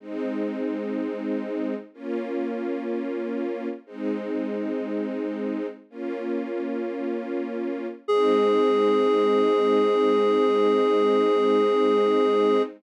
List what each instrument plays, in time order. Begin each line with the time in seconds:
0.00 string ensemble 1 G#3 C4 D#4
1.94 string ensemble 1 A#3 C#4 F4
3.86 string ensemble 1 G#3 C4 D#4
5.90 string ensemble 1 A#3 C#4 F4
8.08 string ensemble 1 G#3 C4 D#4, clarinet G#4